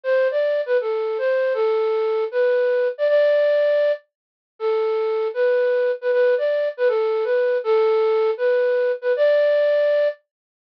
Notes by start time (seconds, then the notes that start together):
0.03 C5
0.31 D5
0.66 B4
0.81 A4
1.18 C5
1.54 A4
2.31 B4
2.98 D5
3.08 D5
4.59 A4
5.34 B4
6.01 B4
6.12 B4
6.38 D5
6.77 B4
6.88 A4
7.24 B4
7.64 A4
8.37 B4
9.01 B4
9.16 D5